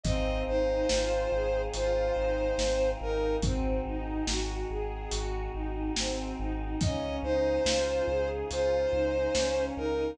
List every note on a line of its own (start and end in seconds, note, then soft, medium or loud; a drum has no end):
0.04 0.40 G#1 loud
0.04 3.39 C4 medium
0.04 0.44 C4 loud
0.04 3.39 D#4 loud
0.04 3.39 F4 loud
0.04 3.39 G#4 medium
0.04 0.43 D#5 loud
0.04 kick loud
0.04 closed hi-hat loud
0.47 0.83 G#1 medium
0.47 0.85 D#4 medium
0.47 1.62 C5 medium
0.89 1.26 G#1 medium
0.89 1.28 F4 medium
0.89 snare loud
1.32 1.68 G#1 medium
1.32 1.70 G#4 medium
1.73 2.10 G#1 medium
1.73 2.13 F4 medium
1.73 2.90 C5 medium
1.73 closed hi-hat loud
2.15 2.52 G#1 medium
2.15 2.54 D#4 medium
2.57 2.94 G#1 medium
2.57 2.95 C4 medium
2.57 snare loud
3.01 3.37 G#1 medium
3.01 3.40 D#4 medium
3.01 3.36 A#4 medium
3.42 3.78 G#1 loud
3.42 3.80 C4 medium
3.42 6.79 C4 medium
3.42 6.79 D#4 medium
3.42 6.79 F#4 loud
3.42 6.79 G#4 medium
3.42 kick loud
3.42 closed hi-hat loud
3.86 4.21 G#1 medium
3.86 4.24 D#4 medium
4.27 4.63 G#1 medium
4.27 4.66 F#4 medium
4.27 snare loud
4.70 5.06 G#1 medium
4.70 5.08 G#4 medium
5.11 5.48 G#1 medium
5.11 5.49 F#4 medium
5.11 closed hi-hat loud
5.53 5.90 G#1 medium
5.53 5.91 D#4 medium
5.96 6.32 G#1 medium
5.96 6.36 C4 medium
5.96 snare loud
6.39 6.75 G#1 medium
6.39 6.77 D#4 medium
6.81 7.18 C#2 medium
6.81 10.15 C#4 medium
6.81 7.20 C#4 medium
6.81 10.15 D#4 medium
6.81 10.15 F4 medium
6.81 10.15 G#4 loud
6.81 7.16 D#5 medium
6.81 kick loud
6.81 closed hi-hat loud
7.23 7.59 C#2 medium
7.23 7.61 D#4 medium
7.23 8.29 C5 medium
7.64 8.01 C#2 medium
7.64 8.02 F4 medium
7.64 snare loud
8.07 8.43 C#2 medium
8.07 8.48 G#4 medium
8.51 8.87 C#2 medium
8.51 8.89 F4 medium
8.51 9.64 C5 medium
8.51 closed hi-hat loud
8.92 9.29 C#2 medium
8.92 9.30 D#4 medium
9.35 9.71 C#2 medium
9.35 9.73 C#4 medium
9.35 snare loud
9.76 10.13 C#2 medium
9.76 10.14 D#4 medium
9.76 10.11 A#4 medium